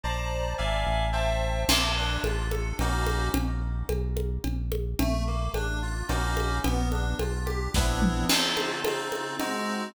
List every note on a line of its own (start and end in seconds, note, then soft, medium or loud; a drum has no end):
0.04 0.55 A#1 medium
0.04 0.53 C5 medium
0.04 0.53 D5 medium
0.04 0.53 A5 medium
0.04 0.53 A#5 medium
0.58 0.85 G#1 medium
0.58 1.07 D5 medium
0.58 1.07 E5 medium
0.58 1.07 F5 medium
0.58 1.07 G#5 medium
0.87 1.65 A1 medium
1.13 1.62 C5 medium
1.13 1.62 E5 medium
1.13 1.62 G5 medium
1.13 1.62 A5 medium
1.68 2.18 A#1 medium
1.68 1.94 A#3 medium
1.68 crash loud
1.68 cowbell medium
1.68 low conga medium
1.97 2.22 D4 medium
2.24 2.73 A1 medium
2.24 2.49 F4 medium
2.24 cowbell medium
2.24 high conga medium
2.51 2.76 A4 medium
2.51 high conga medium
2.79 3.29 A#1 medium
2.79 3.29 A#3 loud
2.79 3.29 C#4 medium
2.79 3.29 D#4 medium
2.79 3.29 F#4 medium
2.79 cowbell medium
2.79 low conga medium
3.07 high conga medium
3.34 3.84 A#1 medium
3.34 cowbell medium
3.34 low conga medium
3.89 4.38 B1 medium
3.89 cowbell medium
3.89 high conga medium
4.17 high conga medium
4.44 4.95 A#1 medium
4.44 cowbell medium
4.44 low conga medium
4.72 high conga medium
4.99 5.49 A#1 medium
4.99 5.24 A3 medium
4.99 cowbell medium
4.99 low conga medium
5.27 5.51 A#3 medium
5.54 6.03 A1 medium
5.54 5.80 D4 medium
5.54 cowbell medium
5.54 high conga medium
5.82 6.07 F4 medium
6.08 6.60 A#1 medium
6.08 6.58 A#3 medium
6.08 6.58 C#4 medium
6.08 6.58 D#4 medium
6.08 6.58 F#4 medium
6.08 cowbell medium
6.08 low conga medium
6.37 high conga medium
6.64 7.14 A#1 medium
6.64 6.88 B3 medium
6.64 cowbell medium
6.64 low conga medium
6.92 7.16 D4 medium
6.92 high conga medium
7.19 7.69 B1 medium
7.19 7.45 F4 medium
7.19 cowbell medium
7.19 high conga medium
7.46 7.70 G4 medium
7.46 high conga medium
7.74 8.25 A#1 medium
7.74 8.25 B3 loud
7.74 8.25 C4 medium
7.74 8.25 D4 loud
7.74 8.25 E4 medium
7.74 kick medium
7.74 snare medium
8.02 mid tom medium
8.29 8.80 C#3 loud
8.29 8.80 C4 medium
8.29 8.80 D#4 medium
8.29 8.80 F4 loud
8.29 crash loud
8.29 cowbell medium
8.29 low conga medium
8.57 high conga medium
8.85 9.35 C#3 medium
8.85 9.35 C4 medium
8.85 9.35 D#4 medium
8.85 9.35 F4 medium
8.85 cowbell medium
8.85 high conga medium
9.12 high conga medium
9.39 9.89 G#3 loud
9.39 9.89 C4 loud
9.39 9.89 D#4 medium
9.39 9.89 F#4 loud
9.39 cowbell medium
9.39 low conga medium